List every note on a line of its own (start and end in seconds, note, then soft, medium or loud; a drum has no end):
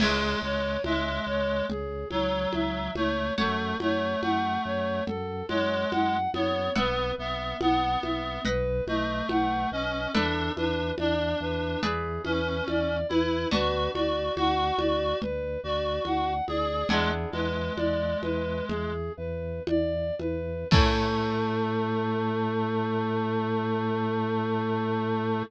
0.00 0.35 C#2 medium
0.00 0.42 G#3 loud
0.00 0.39 G#4 medium
0.00 3.32 C#5 medium
0.00 3.32 E5 loud
0.00 3.32 G#5 medium
0.00 crash loud
0.00 low conga loud
0.42 0.78 C#2 medium
0.42 0.77 G#3 loud
0.42 0.82 C#5 medium
0.84 1.20 C#2 medium
0.84 1.66 G#3 loud
0.84 1.24 E5 medium
0.84 high conga medium
1.27 1.62 C#2 medium
1.27 1.65 C#5 medium
1.69 2.05 C#2 medium
1.69 2.08 G#4 medium
1.69 low conga medium
2.11 2.47 C#2 medium
2.11 2.91 F#3 loud
2.11 2.50 C#5 medium
2.11 high conga medium
2.53 2.90 C#2 medium
2.53 2.93 E5 medium
2.53 high conga medium
2.95 3.31 C#2 medium
2.95 3.33 A3 loud
2.95 3.34 C#5 medium
2.95 high conga medium
3.38 3.74 F#2 medium
3.38 3.77 A3 loud
3.38 3.77 A4 medium
3.38 6.69 C#5 medium
3.38 6.69 F#5 medium
3.38 6.69 A5 medium
3.38 low conga medium
3.79 4.15 F#2 medium
3.79 4.21 A3 loud
3.79 4.20 C#5 medium
3.79 high conga medium
4.22 4.58 F#2 medium
4.22 5.03 A3 loud
4.22 4.62 F#5 medium
4.22 high conga medium
4.65 5.01 F#2 medium
4.65 5.04 C#5 medium
5.07 5.43 F#2 medium
5.07 5.46 A4 medium
5.07 low conga medium
5.48 5.85 F#2 medium
5.48 6.17 G#3 loud
5.48 5.88 C#5 medium
5.48 high conga medium
5.91 6.28 F#2 medium
5.91 6.30 F#5 medium
5.91 high conga medium
6.34 6.70 F#2 medium
6.34 6.71 B3 loud
6.34 6.74 C#5 medium
6.34 high conga medium
6.76 7.12 B1 medium
6.76 7.12 B3 loud
6.76 8.41 B4 medium
6.76 7.15 B4 medium
6.76 8.41 E5 medium
6.76 8.41 F#5 medium
6.76 low conga loud
7.18 7.54 B1 medium
7.18 7.57 B3 loud
7.18 7.58 E5 medium
7.61 7.97 B1 medium
7.61 8.41 B3 loud
7.61 7.99 F#5 medium
7.61 high conga medium
8.03 8.39 B1 medium
8.03 8.42 E5 medium
8.03 high conga medium
8.45 8.81 B1 loud
8.45 10.11 B4 medium
8.45 8.84 B4 medium
8.45 10.11 D#5 medium
8.45 10.11 F#5 medium
8.45 low conga medium
8.87 9.23 B1 medium
8.87 9.70 A3 loud
8.87 9.26 D#5 medium
8.87 high conga medium
9.29 9.66 B1 medium
9.29 9.68 F#5 medium
9.29 high conga medium
9.71 10.07 B1 medium
9.71 10.12 C#4 loud
9.71 10.11 D#5 medium
10.13 10.50 E2 medium
10.13 10.52 D4 loud
10.13 10.52 A4 medium
10.13 11.80 A4 loud
10.13 11.80 B4 medium
10.13 11.80 D5 medium
10.13 11.80 E5 medium
10.13 low conga loud
10.56 10.92 E2 medium
10.56 10.92 D4 medium
10.56 10.95 B4 medium
10.56 high conga medium
10.98 11.35 E2 medium
10.98 11.82 D4 loud
10.98 11.37 D5 medium
10.98 high conga medium
11.40 11.76 E2 medium
11.40 11.80 B4 medium
11.83 12.19 E2 medium
11.83 13.48 G#4 medium
11.83 12.22 G#4 medium
11.83 13.48 B4 medium
11.83 13.48 D5 medium
11.83 13.48 E5 medium
11.83 low conga medium
12.24 12.61 E2 medium
12.24 12.98 C#4 loud
12.24 12.64 B4 medium
12.24 high conga medium
12.68 13.04 E2 medium
12.68 13.07 D5 medium
12.68 high conga medium
13.09 13.46 E2 medium
13.09 13.48 E4 loud
13.09 13.49 B4 medium
13.09 high conga medium
13.51 13.89 D2 medium
13.51 16.83 B3 medium
13.51 16.83 D4 medium
13.51 16.83 F#4 medium
13.51 13.91 F#4 loud
13.51 13.91 B4 medium
13.51 low conga loud
13.94 14.30 D2 medium
13.94 14.35 F#4 medium
13.94 14.33 D5 medium
13.94 high conga medium
14.36 14.72 D2 medium
14.36 15.19 F#4 loud
14.36 14.76 F#5 medium
14.36 high conga medium
14.78 15.14 D2 medium
14.78 15.17 D5 medium
14.78 high conga medium
15.21 15.58 D2 medium
15.21 15.60 B4 medium
15.21 low conga medium
15.64 16.00 D2 medium
15.64 16.33 F#4 medium
15.64 16.03 D5 medium
16.05 16.41 D2 medium
16.05 16.45 F#5 medium
16.05 high conga medium
16.48 16.84 D2 medium
16.48 16.89 G#4 loud
16.48 16.87 D5 medium
16.48 high conga medium
16.89 17.26 E2 medium
16.89 17.11 G#3 loud
16.89 20.63 B3 medium
16.89 20.63 D4 medium
16.89 20.63 E4 medium
16.89 20.63 G#4 medium
16.89 17.30 G#4 medium
16.89 low conga loud
17.32 17.70 E2 medium
17.32 18.92 G#3 loud
17.32 17.73 B4 medium
17.32 high conga medium
17.76 18.15 E2 medium
17.76 18.18 D5 medium
17.76 high conga medium
18.22 18.62 E2 medium
18.22 18.65 B4 medium
18.22 high conga medium
18.68 19.10 E2 medium
18.68 19.12 G#4 medium
18.68 low conga medium
19.17 19.60 E2 medium
19.17 19.63 B4 medium
19.67 20.11 E2 medium
19.67 20.15 D5 medium
19.67 high conga medium
20.19 20.64 E2 medium
20.19 20.68 B4 medium
20.19 high conga medium
20.71 25.43 A2 loud
20.71 25.43 A3 loud
20.71 25.42 C#4 loud
20.71 25.42 E4 loud
20.71 25.42 A4 medium
20.71 25.43 A4 loud
20.71 kick loud
20.71 crash loud